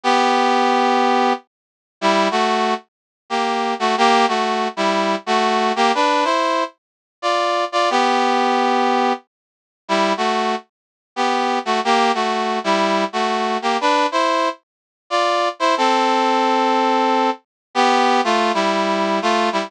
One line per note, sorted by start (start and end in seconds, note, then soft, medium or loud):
0.03 1.33 B3 loud
0.03 1.33 G4 loud
2.01 2.28 G3 loud
2.01 2.28 E4 loud
2.31 2.74 A3 medium
2.31 2.74 F#4 loud
3.30 3.74 A#3 medium
3.30 3.74 G4 medium
3.79 3.95 A3 medium
3.79 3.95 F#4 loud
3.98 4.26 A#3 loud
3.98 4.26 G4 loud
4.28 4.68 A3 medium
4.28 4.68 F#4 medium
4.77 5.16 G3 medium
4.77 5.16 E4 loud
5.26 5.72 A3 medium
5.26 5.72 F#4 loud
5.76 5.92 A#3 loud
5.76 5.92 G4 loud
5.95 6.24 D4 loud
5.95 6.24 B4 loud
6.24 6.64 E4 medium
6.24 6.64 C5 loud
7.22 7.65 F4 medium
7.22 7.65 D5 medium
7.72 7.89 F4 medium
7.72 7.89 D5 loud
7.90 9.13 B3 loud
7.90 9.13 G4 loud
9.88 10.13 G3 medium
9.88 10.13 E4 loud
10.17 10.55 A3 medium
10.17 10.55 F#4 medium
11.16 11.59 B3 medium
11.16 11.59 G4 medium
11.65 11.80 A3 medium
11.65 11.80 F#4 medium
11.85 12.12 A#3 loud
11.85 12.12 G4 loud
12.14 12.59 A3 medium
12.14 12.59 F#4 medium
12.64 13.05 G3 medium
12.64 13.05 E4 loud
13.13 13.58 A3 medium
13.13 13.58 F#4 medium
13.62 13.77 A#3 medium
13.62 13.77 G4 medium
13.81 14.06 D4 loud
13.81 14.06 B4 loud
14.12 14.49 E4 medium
14.12 14.49 C5 loud
15.10 15.49 F4 medium
15.10 15.49 D5 loud
15.59 15.75 E4 loud
15.59 15.75 C5 loud
15.77 17.30 C4 loud
15.77 17.30 A4 loud
17.75 18.21 B3 loud
17.75 18.21 G4 loud
18.24 18.52 A3 medium
18.24 18.52 F4 loud
18.54 19.19 G3 medium
18.54 19.19 E4 loud
19.22 19.49 A3 medium
19.22 19.49 F4 loud
19.52 19.70 G3 medium
19.52 19.70 E4 medium